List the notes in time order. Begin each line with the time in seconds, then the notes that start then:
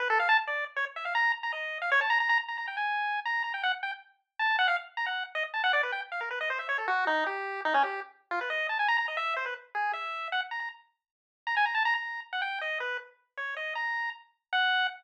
0.00 B4
0.10 A4
0.20 F5
0.29 A5
0.47 D5
0.76 C#5
0.96 E5
1.05 F5
1.15 A#5
1.43 A#5
1.53 D#5
1.82 F5
1.92 C#5
2.01 A5
2.10 A#5
2.20 A#5
2.29 A#5
2.48 A#5
2.58 A#5
2.68 G5
2.77 G#5
3.25 A#5
3.44 A#5
3.54 G5
3.63 F#5
3.83 G5
4.39 A5
4.59 F#5
4.68 F5
4.97 A#5
5.06 F#5
5.35 D#5
5.54 A5
5.64 F#5
5.73 D5
5.83 B4
5.92 G5
6.12 F5
6.21 A#4
6.31 B4
6.41 D#5
6.50 C5
6.59 E5
6.69 C#5
6.78 A4
6.88 F#4
7.07 D#4
7.26 G4
7.65 D#4
7.74 C#4
7.83 G4
8.31 F4
8.41 B4
8.50 D#5
8.69 A5
8.79 G#5
8.88 A#5
8.98 A#5
9.08 D#5
9.17 E5
9.36 C5
9.46 B4
9.75 G#4
9.93 E5
10.32 F#5
10.51 A#5
10.60 A#5
11.47 A#5
11.57 G#5
11.66 A#5
11.75 A5
11.85 A#5
11.95 A#5
12.33 F#5
12.42 G5
12.61 D#5
12.80 B4
13.37 C#5
13.57 D#5
13.75 A#5
14.53 F#5